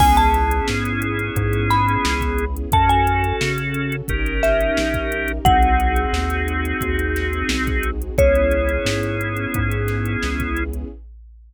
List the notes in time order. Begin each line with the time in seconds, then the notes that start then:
0.00 C#2 B3 C#4 E4 G#4 G#5, kick, crash
0.17 A5, closed hi-hat
0.34 closed hi-hat
0.51 closed hi-hat
0.68 G#2, snare
0.85 closed hi-hat
1.02 closed hi-hat
1.19 closed hi-hat
1.36 G#2, kick, closed hi-hat
1.53 closed hi-hat
1.70 B5, snare, closed hi-hat
1.88 closed hi-hat
2.05 C#2, snare
2.21 kick, closed hi-hat
2.38 closed hi-hat
2.57 closed hi-hat
2.72 F#2 C#4 F#4 A4 A5, kick, closed hi-hat
2.89 G#5, closed hi-hat
3.07 closed hi-hat
3.24 closed hi-hat
3.41 C#3, snare
3.58 closed hi-hat
3.74 closed hi-hat
3.92 closed hi-hat
4.08 G1 C#4 D#4 G4 A#4, kick, closed hi-hat
4.26 closed hi-hat
4.43 E5, snare, closed hi-hat
4.61 closed hi-hat
4.77 A#1, snare
4.94 kick, closed hi-hat
5.12 closed hi-hat
5.28 closed hi-hat
5.45 C2 C4 D#4 F#4 G#4 F#5, kick, closed hi-hat
5.62 closed hi-hat
5.80 closed hi-hat
5.96 closed hi-hat
6.13 D#2, snare
6.30 closed hi-hat
6.48 closed hi-hat
6.65 closed hi-hat
6.81 D#2, kick, closed hi-hat
6.99 closed hi-hat
7.16 snare, closed hi-hat
7.33 closed hi-hat
7.49 C2, snare
7.67 kick, closed hi-hat
7.83 closed hi-hat
8.02 closed hi-hat
8.18 C#2 B3 C#4 E4 G#4 C#5, kick, closed hi-hat
8.35 closed hi-hat
8.51 closed hi-hat
8.69 closed hi-hat
8.85 G#2, snare
9.03 closed hi-hat
9.21 closed hi-hat
9.37 closed hi-hat
9.54 G#2, kick, closed hi-hat
9.71 closed hi-hat
9.88 snare, closed hi-hat
10.06 closed hi-hat
10.23 C#2, snare
10.40 kick, closed hi-hat
10.57 closed hi-hat
10.73 closed hi-hat